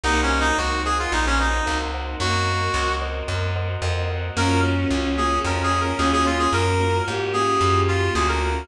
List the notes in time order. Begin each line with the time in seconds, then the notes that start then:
0.03 C2 A#3 C4 D#4 F#4 A#4 C5 D#5 F#5
0.23 C#4
0.40 D#4
0.58 C#2 F#4
0.85 G#4 A#4 C5 D#5 F#5
0.99 F4
1.12 A#1 D#4
1.26 C#4
1.39 D#4 A#4 C5 D#5 F#5
1.66 C#2 A#4 C5 D#5 F#5
1.94 A#4 C5 D#5 F#5
2.20 F#2 A#3 C4 F#4 A#4
2.74 C#2
3.02 A#4 C5 D#5 F#5
3.28 F#2
3.56 A#4 C5 D#5 F#5
3.82 F2 A#4 C5 D#5 F#5
4.10 A#4 C5 D#5 F#5
4.36 F#2 A#3 C#4 F4 F#4 A#4
4.63 A#3 C#4 F4 F#4
4.91 C#2 A#3 C#4 F4 F#4
5.17 A#3 C#4 F4 F#4 G#4
5.45 F2 A#4
5.63 G#4
5.81 A#4
5.98 D#2 A#3 C#4 F4 F#4 G#4
6.13 G#4
6.25 A#3 C#4 F4 F#4
6.39 G#4
6.53 F#2 A#4
6.79 A#3 C#4 F4 F#4
7.06 G#2 A#3 C#4 F4 F#4 G4
7.33 A#3 C#4 F4 F#4 G#4
7.61 F#2
7.88 F4
8.14 D2 A#3 C#4 F4 F#4 G#4
8.28 A#4
8.41 A#3 C#4 F4 F#4